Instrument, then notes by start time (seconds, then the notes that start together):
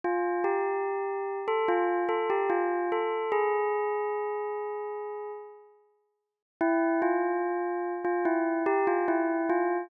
tubular bells
0.04 F4
0.44 G4
1.48 A4
1.68 F4
2.09 A4
2.30 G4
2.50 F4
2.92 A4
3.32 G#4
6.61 E4
7.02 F4
8.04 F4
8.25 E4
8.66 G4
8.87 F4
9.08 E4
9.49 F4